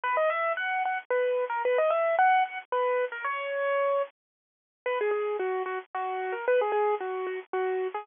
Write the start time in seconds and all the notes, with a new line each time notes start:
0.03 B4
0.17 D#5
0.30 E5
0.57 F#5
0.85 F#5
1.10 B4
1.50 A#4
1.65 B4
1.78 D#5
1.90 E5
2.19 F#5
2.45 F#5
2.72 B4
3.12 A#4
3.24 C#5
4.86 B4
5.01 G#4
5.11 G#4
5.39 F#4
5.66 F#4
5.94 F#4
6.32 A#4
6.48 B4
6.61 G#4
6.72 G#4
7.00 F#4
7.27 F#4
7.53 F#4
7.94 G#4